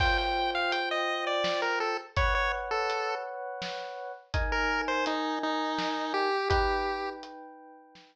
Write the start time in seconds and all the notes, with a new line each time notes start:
0.00 F4 C5 G5, kick, crash
0.18 G5
0.55 F5
0.72 G5, closed hi-hat
0.91 D#5
1.27 D5
1.44 snare
1.62 A#4
1.80 A4
2.16 B4 C#5 F#5, kick, closed hi-hat
2.35 C#5
2.71 A4
2.90 closed hi-hat
3.62 snare
4.34 D#4 A#4 G#5, kick, closed hi-hat
4.52 A#4
4.88 C5
5.06 D#4, closed hi-hat
5.43 D#4
5.78 snare
6.14 G4
6.50 D#4 G4 B4 G5, kick, closed hi-hat
7.23 closed hi-hat
7.95 snare